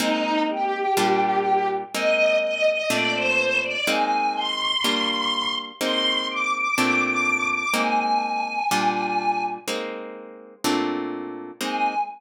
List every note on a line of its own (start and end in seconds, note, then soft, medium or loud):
0.00 0.86 G#3 loud
0.00 0.86 A#3 loud
0.00 0.86 C4 loud
0.00 0.86 D#4 loud
0.00 0.40 D#4 loud
0.49 1.68 G4 loud
0.97 1.84 A#2 loud
0.97 1.84 G3 loud
0.97 1.84 D4 loud
0.97 1.84 F4 loud
1.94 2.82 G#3 loud
1.94 2.82 A#3 loud
1.94 2.82 C4 loud
1.94 2.82 D#4 loud
1.94 2.36 D#5 loud
2.42 2.65 D#5 loud
2.66 2.89 D#5 loud
2.90 3.77 A#2 loud
2.90 3.77 A3 loud
2.90 3.77 C4 loud
2.90 3.77 D4 loud
2.90 3.13 D5 loud
3.15 3.57 C5 loud
3.63 3.86 D5 loud
3.87 4.74 G#3 loud
3.87 4.74 A#3 loud
3.87 4.74 C4 loud
3.87 4.74 D#4 loud
3.87 4.33 G#5 loud
4.35 5.53 C6 loud
4.84 5.71 G3 loud
4.84 5.71 A#3 loud
4.84 5.71 D4 loud
4.84 5.71 F4 loud
5.80 6.68 G#3 loud
5.80 6.68 A#3 loud
5.80 6.68 C4 loud
5.80 6.68 D#4 loud
5.80 6.25 C6 loud
6.29 6.52 D6 loud
6.53 6.76 D6 loud
6.77 7.65 A#2 loud
6.77 7.65 A3 loud
6.77 7.65 C4 loud
6.77 7.65 D4 loud
6.77 7.00 D6 loud
7.02 7.48 D6 loud
7.50 7.73 D6 loud
7.74 8.61 G#3 loud
7.74 8.61 A#3 loud
7.74 8.61 C4 loud
7.74 8.61 D#4 loud
7.74 9.41 G#5 loud
8.71 9.58 A#2 loud
8.71 9.58 G3 loud
8.71 9.58 D4 loud
8.71 9.58 F4 loud
9.68 10.55 G#3 loud
9.68 10.55 A#3 loud
9.68 10.55 C4 loud
9.68 10.55 D#4 loud
10.64 11.51 A#2 loud
10.64 11.51 A3 loud
10.64 11.51 C4 loud
10.64 11.51 D4 loud
11.61 11.95 G#3 loud
11.61 11.95 A#3 loud
11.61 11.95 C4 medium
11.61 11.95 D#4 loud
11.61 11.95 G#5 loud